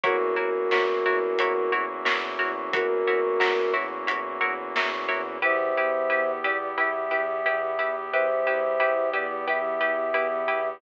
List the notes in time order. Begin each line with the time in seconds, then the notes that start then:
0.04 E2 A#3 C#4 E4 F#4 A#4 C#5, kick, closed hi-hat
0.36 E2 E4 F#4 A#4 C#5
0.71 E2 E4 F#4 A#4 C#5, snare
1.05 E2 E4 F#4 A#4 C#5
1.39 E2 E4 F#4 A#4 C#5, closed hi-hat
1.72 E2 E4 F#4 A#4 C#5
2.05 E2 E4 F#4 A#4 C#5, snare
2.39 E2 E4 F#4 A#4 C#5
2.73 E2 E4 F#4 A#4 C#5, kick, closed hi-hat
3.07 E2 E4 F#4 A#4 C#5
3.40 E2 E4 F#4 A#4 C#5, snare
3.74 E2 E4 F#4 A#4 C#5
4.07 E2 E4 F#4 A#4 C#5, closed hi-hat
4.41 E2 E4 F#4 A#4 C#5
4.76 E2 E4 F#4 A#4 C#5, snare
5.08 E2 E4 F#4 A#4 C#5
5.42 E2 B3 E4 G4 B4 C5 E5
5.76 E2 E4 G4 B4
6.10 E2 E4 G4 B4
6.44 E2 E4 G4 B4 D5
6.78 E2 E4 G4 B4 E5
7.11 E2 E4 G4 B4
7.46 E2 E4 G4 B4
7.79 E2 E4 G4 B4
8.12 E2 E4 G4 B4 C5 E5
8.46 E2 E4 G4 B4
8.80 E2 E4 G4 B4
9.13 E2 E4 G4 B4 D5
9.47 E2 E4 G4 B4 E5
9.81 E2 E4 G4 B4
10.14 E2 E4 G4 B4
10.48 E2 E4 G4 B4